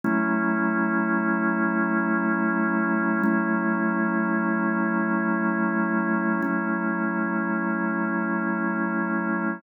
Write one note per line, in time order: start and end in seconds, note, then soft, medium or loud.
0.04 3.22 F#3 medium
0.04 3.22 A3 loud
0.04 3.22 C#4 loud
0.04 3.22 E4 loud
3.23 6.41 F#3 medium
3.23 6.41 A3 loud
3.23 6.41 C#4 medium
3.23 6.41 E4 medium
6.42 9.60 F#3 medium
6.42 9.60 A3 medium
6.42 9.60 C#4 medium
6.42 9.60 E4 medium